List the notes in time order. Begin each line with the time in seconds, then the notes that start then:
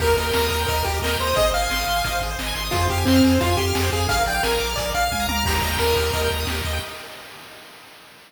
0.00 D#2 G4 A#4, kick, crash
0.07 A#4
0.16 D#2 A#4 D#5, closed hi-hat
0.26 G5
0.33 D#2 A#5, snare
0.44 D#6
0.50 D#2 A#4 A#5, closed hi-hat
0.59 G5
0.66 D#2 A#4 D#5, kick, closed hi-hat
0.76 A#4
0.84 D#2 G4, closed hi-hat
0.94 A#4
1.02 D#2 A#4 D#5, snare
1.11 G5
1.19 D#2 C5 A#5, closed hi-hat
1.27 D#6
1.35 G#1 G#4 D#5, kick, closed hi-hat
1.46 C5
1.53 G#1 D#5 F5, closed hi-hat
1.62 G#5
1.70 G#1 C6, snare
1.79 D#6
1.86 G#1 C6, closed hi-hat
1.96 G#5
2.04 G#1 D#5, kick, closed hi-hat
2.12 C5
2.20 G#1 G#4, kick, closed hi-hat
2.30 C5
2.38 G#1 D#5, snare
2.46 G#5
2.55 G#1 C6, closed hi-hat
2.65 D#6
2.71 F2 F4 G#4, kick, closed hi-hat
2.81 C5
2.89 F2 G4 F5, closed hi-hat
2.98 G#5
3.05 F2 C4 C6, snare
3.15 F6
3.24 F2 G#4, closed hi-hat
3.33 C5
3.41 F2 F4 F5, kick, closed hi-hat
3.50 G#5
3.57 F2 G4 C6, closed hi-hat
3.67 F6
3.75 F2 G#4, snare
3.83 C5
3.92 F2 G#4 F5, kick, closed hi-hat
4.00 G#5
4.09 A#1 G#4 F5, kick, closed hi-hat
4.17 A#4
4.26 A#1 D5 G5, closed hi-hat
4.35 F5
4.43 A#1 A#4 G#5, snare
4.52 A#5
4.59 A#1 D6, closed hi-hat
4.69 F6
4.76 A#1 G#4 D5, kick, closed hi-hat
4.86 A#4
4.94 A#1 D5 F5, closed hi-hat
5.03 F5
5.12 C#2 G#5, kick, high tom
5.20 A#5
5.28 D2 A#5 D6, high tom
5.36 F6
5.45 D#2 G4 A#5, kick, crash
5.54 A#4
5.62 D#2 D#5, closed hi-hat
5.72 G5
5.78 D#2 A#4 A#5, snare
5.87 D#6
5.96 D#2 G4, closed hi-hat
6.05 A#4
6.13 D#2 D#5, kick, closed hi-hat
6.23 G5
6.30 D#2 A#5, closed hi-hat
6.40 D#6
6.47 D#2 G4, snare
6.56 A#4
6.65 D#2 D#5, closed hi-hat
6.73 G5